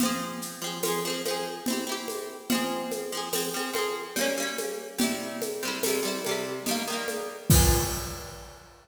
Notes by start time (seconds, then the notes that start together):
0.00 F3 C4, low conga, shaker
0.05 G#4
0.42 shaker
0.62 F3 C4
0.66 G#4
0.83 F3 C4, tambourine, high conga, shaker
0.88 G#4
1.05 F3 C4
1.10 G#4
1.25 F3 C4, high conga, shaker
1.31 G#4
1.66 C4 E4, low conga, shaker
1.73 G4
1.87 C4 E4
1.92 G4
2.08 high conga, shaker
2.50 F3 C4, low conga, shaker
2.55 G#4
2.91 high conga, shaker
3.12 F3 C4
3.17 G#4
3.33 F3 C4, tambourine, high conga, shaker
3.37 G#4
3.54 F3 C4
3.59 G#4
3.73 F3 C4, high conga, shaker
3.78 G#4
4.16 G3 A#3, low conga, shaker
4.21 C#4
4.37 G3 A#3
4.42 C#4
4.58 high conga, shaker
4.98 C3 G3, low conga, shaker
5.03 E4
5.42 high conga, shaker
5.63 C3 G3
5.68 E4
5.83 C3 G3, tambourine, high conga, shaker
5.89 E4
6.03 C3 G3
6.07 E4
6.24 C3, high conga, shaker
6.29 G3 E4
6.66 D#3 G3, low conga, shaker
6.71 A#3
6.87 D#3 G3
6.92 A#3
7.08 high conga, shaker
7.50 F3 C4, kick, crash
7.55 G#4